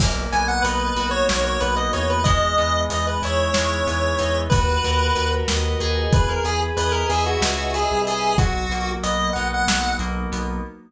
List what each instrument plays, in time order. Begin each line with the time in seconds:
0.00 synth bass 1 B1, electric piano 2 A#3, kick, crash
0.32 synth bass 1 B1, electric piano 2 B3, lead 1 (square) G#5, closed hi-hat
0.48 lead 1 (square) F#5
0.62 synth bass 1 B1, electric piano 2 D#4, lead 1 (square) B4, closed hi-hat
0.96 synth bass 1 B1, electric piano 2 F#4, closed hi-hat
1.11 lead 1 (square) C#5
1.29 synth bass 1 B1, electric piano 2 A#3, lead 1 (square) C#5, snare
1.45 lead 1 (square) C#5
1.60 synth bass 1 B1, electric piano 2 B3, lead 1 (square) B4, closed hi-hat
1.76 lead 1 (square) D#5
1.93 synth bass 1 E2, electric piano 2 D#4, lead 1 (square) C#5, closed hi-hat
2.10 lead 1 (square) B4
2.24 electric piano 2 G#3, lead 1 (square) D#5, kick, closed hi-hat
2.58 synth bass 1 E2, electric piano 2 B3, closed hi-hat
2.90 synth bass 1 E2, electric piano 2 D#4, lead 1 (square) D#5, closed hi-hat
3.07 lead 1 (square) B4
3.22 synth bass 1 E2, electric piano 2 E4, lead 1 (square) C#5, closed hi-hat
3.54 synth bass 1 E2, electric piano 2 G#3, snare
3.87 synth bass 1 E2, electric piano 2 B3, closed hi-hat
4.19 synth bass 1 E2, electric piano 2 D#4, closed hi-hat
4.50 synth bass 1 D#2, electric piano 2 F#4, lead 1 (square) B4, kick, closed hi-hat
4.84 synth bass 1 D#2, electric piano 2 A#4, closed hi-hat
5.16 synth bass 1 D#2, electric piano 2 B4, closed hi-hat
5.48 synth bass 1 D#2, electric piano 2 D#5, snare
5.80 synth bass 1 D#2, electric piano 2 G#4, closed hi-hat
6.12 synth bass 1 E2, lead 1 (square) B4, kick, closed hi-hat
6.29 lead 1 (square) A#4
6.44 synth bass 1 E2, lead 1 (square) G#4, electric piano 2 B4, closed hi-hat
6.77 synth bass 1 E2, lead 1 (square) B4, electric piano 2 D#5, closed hi-hat
6.92 lead 1 (square) A#4
7.10 synth bass 1 E2, lead 1 (square) G#4, electric piano 2 E5, closed hi-hat
7.26 lead 1 (square) F#4
7.41 synth bass 1 C#2, electric piano 2 G#4, snare
7.74 lead 1 (square) G#4, electric piano 2 B4, closed hi-hat
7.91 synth bass 1 C2
8.07 lead 1 (square) G#4, electric piano 2 D#5, closed hi-hat
8.38 synth bass 1 B1, electric piano 2 F#3, lead 1 (square) F#4, kick, closed hi-hat
8.70 synth bass 1 B1, electric piano 2 A#3, closed hi-hat
9.03 synth bass 1 B1, electric piano 2 B3, lead 1 (square) D#5, closed hi-hat
9.33 synth bass 1 B1, electric piano 2 D#4, lead 1 (square) F#5, closed hi-hat
9.54 lead 1 (square) F#5
9.67 synth bass 1 B1, electric piano 2 F#3, snare
9.99 synth bass 1 B1, electric piano 2 A#3, closed hi-hat
10.32 synth bass 1 B1, electric piano 2 B3, closed hi-hat